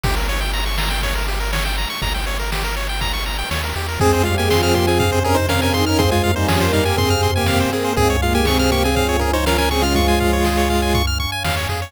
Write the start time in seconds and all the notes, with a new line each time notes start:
0.04 G1 G4, kick, ride
0.16 A#4
0.28 C#5, ride
0.41 G5
0.53 A#5, ride
0.66 C#6
0.78 A#5, snare
0.90 G5
1.02 C#5, kick, ride
1.15 A#4
1.27 G4, ride
1.40 A#4
1.53 C#5, snare
1.65 G5
1.77 A#5, ride
1.90 C#6
2.02 G1 A#5, kick, ride
2.14 G5
2.27 C#5, ride
2.39 A#4
2.52 G4, snare
2.64 A#4
2.76 C#5, ride
2.89 G5
3.01 A#5, kick, ride
3.13 C#6
3.26 A#5, ride
3.39 G5
3.51 D#2 C#5, snare
3.64 A#4
3.75 E2 G4, ride
3.89 A#4
4.00 F2 G#3 C4 G#4 C5 F5 G#5, kick, floor tom
4.13 C5
4.23 G3 G#3 F4 G4 F5, floor tom
4.38 G#3 A#3 G4 G#4 G#5
4.50 F3 C4 F4 G#4 C6, snare
4.63 F3 C4 F4 G#4 F6
4.74 A#3 G4 C6, floor tom
4.87 C4 G#4 G#5
5.00 C3 C4 F5, kick, floor tom
5.12 C5
5.23 C#4 G#4 A#4, floor tom
5.35 D#4 C5
5.49 C#4 A#4 F5, snare
5.62 C#4 A#4 G#5
5.73 D#3 C4 D#4 G#4 C6, floor tom
5.86 C#4 A#4 F6
5.99 C4 G#4 C5 C6, kick, floor tom
6.11 G#3 F4 G#5
6.24 A#3 A#4 F5, floor tom
6.36 G3 C4 D#4 C5
6.48 F3 G3 C#4 G4 G#4, snare
6.61 A#3 A#4 C5
6.73 G3 D#4 F5, floor tom
6.85 A#3 G4 G#5
6.97 C3 C4 G#4 C6, kick, floor tom
7.10 F6
7.23 C6, floor tom
7.36 A#3 G4 G#5
7.46 F5, snare
7.60 C5
7.72 A#3 C4 G#4 A#4
7.85 C5
7.96 C#2 G#2 G#3 C4 G#4 C#5 F5 G#5, kick, floor tom
8.10 C#5
8.22 A#2 G#3 A#3 F4 F5, floor tom
8.34 G#2 G#3 A#3 G4 G#5
8.45 C3 C4 G#4 C#6, snare
8.59 C3 C4 G#4 F6
8.71 A#3 G4 C#6, floor tom
8.84 C4 G#4 G#5
8.96 F3 F4 F5, kick, floor tom
9.09 C#5
9.20 C#4 G#4 A#4, floor tom
9.33 D#4 C5 C#5
9.46 C#4 A#4 F5, snare
9.58 C#4 A#4 G#5
9.71 C#3 C4 C#4 G#4 C#6, floor tom
9.82 G#3 F4 F6
9.94 F3 G#3 F4 C#6, kick, floor tom
10.08 G#5
10.20 F5, kick, floor tom
10.33 C#5
10.45 G#4, snare
10.58 C#5
10.69 F5, floor tom
10.82 G#5
10.94 C#6, kick, floor tom
11.07 F6
11.20 C#6, floor tom
11.32 G#5
11.45 E2 F5, snare
11.57 C#5
11.69 F2 G#4, floor tom
11.82 C#5